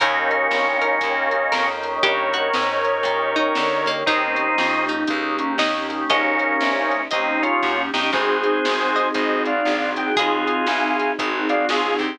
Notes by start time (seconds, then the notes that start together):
0.00 D#2 A#3 C#4 D#4 G4 A#4 C#5 D#5 G5, kick, closed hi-hat
0.31 closed hi-hat
0.50 C2 A#3 C#4 D#4 G4, snare
0.81 A#3 C#4 D#4 G4 A#4, closed hi-hat
1.00 D#2 A#3 C#4 D#4 G4, kick, closed hi-hat
1.31 A#3 C#4 D#4 G4, closed hi-hat
1.52 F2 A#3 C#4 D#4 G4 A#4, snare
1.83 closed hi-hat
2.03 G2 G4 A#4 C#5, kick, closed hi-hat
2.33 F#4, closed hi-hat
2.53 G#2 A#3 C#4 D#4 G4, snare
2.85 A#3 C#4 D#4 G4, closed hi-hat
3.03 A#2 A#3 C#4 D#4 G4, kick, closed hi-hat
3.36 A#3 C#4 D#4 G4, closed hi-hat
3.55 D3 A#3 C#4 D#4 G4, snare
3.86 A#3, kick, closed hi-hat
4.06 D#2 A#3 C4 C#4 D#4 G4, kick, closed hi-hat
4.36 closed hi-hat
4.58 F2, snare
4.88 D#4, closed hi-hat
5.07 C#2 A#3 C#4 D#4 G4, kick, closed hi-hat
5.39 A#3 C#4 D#4 G4, closed hi-hat
5.58 D#2 A#3 C#4 D#4 G4, snare
5.88 A#3 C#4 D#4 G4, closed hi-hat
6.09 A#1 A#3 C#4 D#5, kick, closed hi-hat
6.39 closed hi-hat
6.61 C2, snare
6.91 closed hi-hat
7.11 D#2 A#3 C4 C#4 D#4 G4 D#5, kick, closed hi-hat
7.42 A#3 C#4 D#4 F4 G4, closed hi-hat
7.62 F#2 A#3 C#4 D#4 G4, kick, snare
7.93 G2 A#3 C#4 D#4 G4, snare
8.13 G#1 C4 D#4 F#4 G#4 C5, kick, crash
8.43 closed hi-hat
8.65 G#1, snare
8.96 D#5, closed hi-hat
9.14 G#1 C4 D#4 F#4 G#4 C5 D#5, kick, closed hi-hat
9.45 C4 D#4 F#4 G#4 D5 F5, closed hi-hat
9.65 A#1 C4 D#4 F#4 G#4, snare
9.96 C4 D#4 F#4 G#4 G5, closed hi-hat
10.16 D#2 F4 G#4, kick, closed hi-hat
10.47 closed hi-hat
10.67 C2 F5 G#5, snare
10.99 closed hi-hat
11.19 G#1 C4 D#4 F#4 G#4, kick, closed hi-hat
11.49 C4 D#4 F#4 G#4 D5 F5, closed hi-hat
11.69 C#2 C4 D#4 F4 F#4 G#4, snare
11.99 D2 C4 D#4 F#4 G4 G#4, kick, closed hi-hat